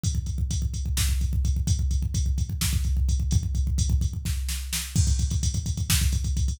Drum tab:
CC |--------------|--------------|--------------|x-------------|
HH |x-x-x-x---x-x-|x-x-x-x---x-x-|x-x-x-x-------|-xxxxxxx-xxxxo|
SD |--------o-----|--------o-----|--------o-o-o-|--------o-----|
BD |oooooooooooooo|oooooooooooooo|ooooooooo-----|oooooooooooooo|